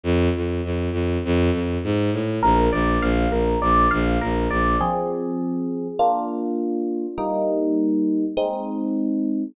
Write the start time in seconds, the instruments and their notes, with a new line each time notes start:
0.03 violin F2
0.36 violin F2
0.64 violin F2
0.92 violin F2
1.25 violin F2
1.52 violin F2
1.84 violin G#2
2.12 violin A2
2.43 violin A#1, electric piano 1 A#4
2.72 violin A#1, electric piano 1 D5
3.01 violin A#1, electric piano 1 F5
3.30 violin A#1, electric piano 1 A#4
3.62 violin A#1, electric piano 1 D5
3.91 violin A#1, electric piano 1 F5
4.21 violin A#1, electric piano 1 A#4
4.50 violin A#1, electric piano 1 D5
4.81 electric piano 1 F3 C4 G#4
5.99 electric piano 1 A#3 D4 F4
7.18 electric piano 1 G3 A#3 D#4
8.37 electric piano 1 G#3 C4 D#4